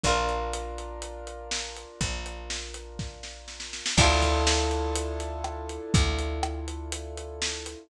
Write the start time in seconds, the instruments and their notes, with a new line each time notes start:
0.03 electric bass (finger) A#1, acoustic grand piano D4 F4 A#4, acoustic guitar (steel) D4 F4, kick, closed hi-hat
0.08 acoustic guitar (steel) A#4
0.29 closed hi-hat
0.53 closed hi-hat
0.78 closed hi-hat
1.02 closed hi-hat
1.27 closed hi-hat
1.51 snare
1.76 closed hi-hat
2.01 electric bass (finger) A#1, kick, closed hi-hat
2.26 closed hi-hat
2.50 snare
2.74 closed hi-hat
2.99 kick, snare
3.23 snare
3.48 snare
3.60 snare
3.73 snare
3.86 snare
3.97 electric bass (finger) D2, acoustic guitar (steel) D4 E4 F4, acoustic grand piano D4 E4 F4 A4, kick, crash
4.03 acoustic guitar (steel) A4
4.22 kick, closed hi-hat
4.47 snare
4.71 closed hi-hat
4.95 closed hi-hat
5.20 closed hi-hat
5.44 cross-stick
5.69 closed hi-hat
5.94 electric bass (finger) D2, kick, closed hi-hat
6.19 closed hi-hat
6.43 cross-stick
6.68 closed hi-hat
6.92 closed hi-hat
7.17 closed hi-hat
7.42 snare
7.66 closed hi-hat